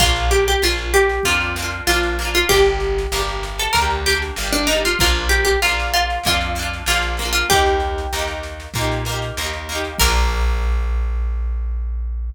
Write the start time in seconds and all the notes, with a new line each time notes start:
0.00 A#1 A#3 D4 F4, kick, snare
0.06 F4
0.16 snare
0.31 G4, snare
0.47 G4, snare
0.62 A#1 A#3 D4 F4, snare
0.68 F4
0.77 snare
0.94 G4, snare
1.09 snare
1.23 F2 A#3 F4, kick, snare
1.28 D4 F4
1.41 snare
1.56 A#3 D4, snare
1.62 F4
1.70 snare
1.87 A#1 A#3 D4 F4, snare
1.94 F4
2.03 snare
2.19 A#3 D4, snare
2.25 F4
2.34 F4, snare
2.49 G1 A#3 D4 G4, kick, snare
2.56 G4
2.65 snare
2.80 snare
2.98 snare
3.12 G1 A#3, snare
3.16 D4 G4
3.28 snare
3.43 snare
3.58 A4, snare
3.73 D2 A#3 A#4, kick, snare
3.78 D4 G4
3.90 snare
4.06 A#3 D4 G4, snare
4.13 G4
4.22 snare
4.36 G1 A#3, snare
4.40 D4 G4
4.52 D4, snare
4.67 A#3 D#4, snare
4.71 D4 G4
4.85 F4, snare
4.99 A#1 A#3 F4, kick, snare
5.03 D4 F4
5.14 snare
5.29 G4, snare
5.45 G4, snare
5.62 A#1 A#3 D4 F4, snare
5.69 F4
5.80 snare
5.94 F4, snare
6.10 snare
6.24 F2 A#3 F4, kick, snare
6.28 D4 F4
6.41 snare
6.55 A#3, snare
6.59 D4 F4
6.73 snare
6.86 A#1 A#3 F4, snare
6.90 D4 F4
7.02 snare
7.17 A#3, snare
7.22 D4 F4
7.33 F4, snare
7.50 D#2 A#3 D#4 G4, kick, snare
7.56 G4
7.66 snare
7.80 snare
7.98 snare
8.13 D#2 A#3 D#4, snare
8.19 G4
8.27 snare
8.43 snare
8.60 snare
8.74 A#2 A#3, kick, snare
8.78 D#4 G4
8.92 snare
9.05 A#3, snare
9.09 D#4 G4
9.22 snare
9.37 D#2 A#3 D#4, snare
9.44 G4
9.53 snare
9.69 A#3 D#4, snare
9.75 G4
9.84 snare
9.98 A#1 A#3 A#4, kick, crash
10.03 D4 F4